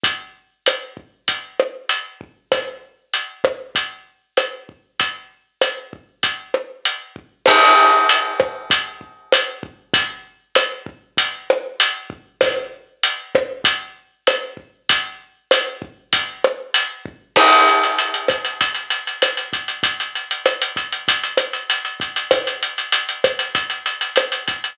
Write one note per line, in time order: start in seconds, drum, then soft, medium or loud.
0.03 kick medium
0.03 closed hi-hat medium
0.66 cross-stick medium
0.66 closed hi-hat medium
0.97 kick medium
1.28 kick medium
1.28 closed hi-hat medium
1.60 cross-stick medium
1.89 closed hi-hat medium
2.21 kick medium
2.52 kick medium
2.52 cross-stick medium
2.52 closed hi-hat medium
3.14 closed hi-hat medium
3.44 kick medium
3.44 cross-stick medium
3.75 kick medium
3.75 closed hi-hat medium
4.37 cross-stick medium
4.37 closed hi-hat medium
4.69 kick soft
5.00 kick medium
5.00 closed hi-hat medium
5.61 cross-stick medium
5.61 closed hi-hat medium
5.93 kick medium
6.23 kick medium
6.23 closed hi-hat medium
6.54 cross-stick medium
6.85 closed hi-hat medium
7.16 kick medium
7.46 kick medium
7.46 cross-stick loud
7.46 crash loud
8.09 closed hi-hat loud
8.40 kick medium
8.40 cross-stick medium
8.70 kick medium
8.70 closed hi-hat medium
9.01 kick soft
9.32 cross-stick medium
9.32 closed hi-hat loud
9.63 kick medium
9.94 kick loud
9.94 closed hi-hat loud
10.55 cross-stick medium
10.55 closed hi-hat loud
10.86 kick medium
11.17 kick medium
11.17 closed hi-hat loud
11.50 cross-stick medium
11.80 closed hi-hat loud
12.10 kick medium
12.41 kick medium
12.41 cross-stick loud
12.41 closed hi-hat loud
13.03 closed hi-hat medium
13.35 kick medium
13.35 cross-stick medium
13.64 kick medium
13.64 closed hi-hat loud
14.27 cross-stick medium
14.27 closed hi-hat medium
14.57 kick medium
14.89 kick medium
14.89 closed hi-hat loud
15.51 cross-stick medium
15.51 closed hi-hat loud
15.82 kick medium
16.13 kick medium
16.13 closed hi-hat loud
16.44 cross-stick medium
16.74 closed hi-hat loud
17.06 kick medium
17.36 kick medium
17.36 cross-stick medium
17.36 crash medium
17.53 closed hi-hat medium
17.68 closed hi-hat medium
17.83 closed hi-hat medium
17.98 closed hi-hat medium
18.14 closed hi-hat medium
18.28 kick medium
18.28 cross-stick medium
18.28 closed hi-hat medium
18.45 closed hi-hat medium
18.61 kick medium
18.61 closed hi-hat medium
18.74 closed hi-hat medium
18.90 closed hi-hat medium
19.07 closed hi-hat medium
19.22 cross-stick medium
19.22 closed hi-hat medium
19.37 closed hi-hat medium
19.53 kick medium
19.53 closed hi-hat medium
19.68 closed hi-hat medium
19.83 kick medium
19.83 closed hi-hat medium
20.00 closed hi-hat medium
20.15 closed hi-hat medium
20.31 closed hi-hat medium
20.45 cross-stick medium
20.45 closed hi-hat medium
20.62 closed hi-hat medium
20.76 kick medium
20.76 closed hi-hat medium
20.92 closed hi-hat medium
21.08 kick medium
21.08 closed hi-hat medium
21.23 closed hi-hat medium
21.37 cross-stick medium
21.37 closed hi-hat medium
21.53 closed hi-hat medium
21.70 closed hi-hat medium
21.85 closed hi-hat medium
22.00 kick medium
22.00 closed hi-hat medium
22.16 closed hi-hat medium
22.31 kick medium
22.31 cross-stick medium
22.31 closed hi-hat medium
22.47 closed hi-hat medium
22.63 closed hi-hat medium
22.78 closed hi-hat medium
22.92 closed hi-hat medium
23.09 closed hi-hat medium
23.24 kick medium
23.24 cross-stick medium
23.24 closed hi-hat medium
23.39 closed hi-hat medium
23.55 kick medium
23.55 closed hi-hat medium
23.70 closed hi-hat medium
23.86 closed hi-hat medium
24.01 closed hi-hat medium
24.16 cross-stick medium
24.16 closed hi-hat medium
24.32 closed hi-hat medium
24.48 kick medium
24.48 closed hi-hat medium
24.64 closed hi-hat medium